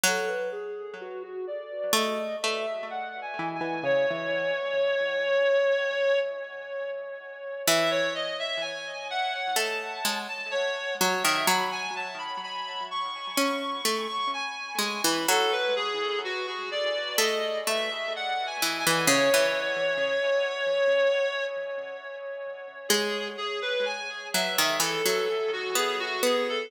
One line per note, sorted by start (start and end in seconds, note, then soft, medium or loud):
0.04 1.23 F#3 loud
0.04 0.29 A4 loud
0.27 0.50 B4 loud
0.52 0.95 G#4 loud
1.01 1.23 F#4 medium
1.23 1.46 F#4 medium
1.47 1.92 D5 medium
1.93 2.36 A3 loud
1.93 2.36 D#5 medium
2.42 2.66 A3 medium
2.42 2.88 E5 medium
2.90 3.20 F#5 medium
3.22 3.52 G#5 medium
3.39 3.61 E3 loud
3.55 3.85 G#5 medium
3.61 3.84 E3 loud
3.83 4.06 C#3 loud
3.83 6.19 C#5 loud
4.11 6.22 E3 loud
7.67 8.87 E3 loud
7.67 7.90 E5 loud
7.91 8.13 C#5 loud
8.15 8.38 D#5 medium
8.39 8.62 E5 loud
8.61 9.08 G#5 medium
9.10 9.56 F#5 medium
9.56 10.00 A3 loud
9.56 10.19 A5 medium
10.05 10.28 G#3 loud
10.29 10.51 A5 medium
10.51 10.94 C#5 loud
11.01 11.24 F#3 loud
11.01 11.23 C#5 medium
11.23 11.47 D#3 loud
11.23 11.46 E5 medium
11.47 12.72 F#3 loud
11.47 11.71 B5 medium
11.72 11.94 G#5 loud
11.96 12.18 A5 medium
12.18 12.41 B5 medium
12.43 12.85 B5 medium
12.91 13.37 C#6 medium
13.38 13.81 C#4 loud
13.38 14.07 C#6 medium
13.85 14.08 A3 loud
14.09 14.31 C#6 loud
14.34 14.80 G#5 medium
14.79 15.01 G#3 medium
14.79 15.03 G#5 medium
15.04 15.27 E3 loud
15.04 15.28 B5 medium
15.29 16.48 F#3 loud
15.29 15.52 A4 loud
15.52 15.75 B4 loud
15.76 16.19 G#4 loud
16.24 16.46 F#4 medium
16.47 16.70 F#4 medium
16.71 17.16 D5 medium
17.18 17.61 A3 loud
17.18 17.59 D#5 medium
17.67 17.90 A3 medium
17.67 18.12 E5 medium
18.16 18.46 F#5 medium
18.47 18.77 G#5 medium
18.62 18.85 E3 loud
18.79 19.09 G#5 medium
18.87 19.09 E3 loud
19.08 19.30 C#3 loud
19.08 21.44 C#5 loud
19.34 21.46 E3 loud
22.89 23.36 G#3 loud
22.89 23.28 G#4 loud
23.38 23.60 G#4 medium
23.62 23.85 B4 medium
23.86 24.27 G#5 medium
24.34 24.57 F#3 loud
24.34 24.77 E5 medium
24.59 24.81 D#3 loud
24.80 25.03 E3 loud
24.80 25.51 A4 medium
25.06 25.28 F#3 loud
25.53 25.76 F#4 medium
25.75 26.18 B3 loud
25.75 25.99 G#4 medium
26.00 26.22 F#4 loud
26.23 26.67 B3 loud
26.23 26.47 G#4 medium
26.49 26.71 A4 medium